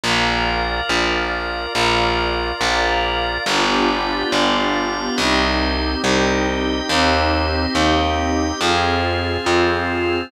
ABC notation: X:1
M:4/4
L:1/8
Q:1/4=70
K:Cm
V:1 name="Pad 5 (bowed)"
[Bdf]4 [Bdf]4 | [=B,DFG]4 [CEG]4 | [CEG]4 [CFA]4 |]
V:2 name="Drawbar Organ"
[FBd]4 [FBd]4 | [FG=Bd]2 [FGdf]2 [Gce]2 [Geg]2 | [Gce]2 [Geg]2 [FAc]2 [CFc]2 |]
V:3 name="Electric Bass (finger)" clef=bass
B,,,2 B,,,2 B,,,2 B,,,2 | G,,,2 G,,,2 C,,2 C,,2 | E,,2 E,,2 F,,2 F,,2 |]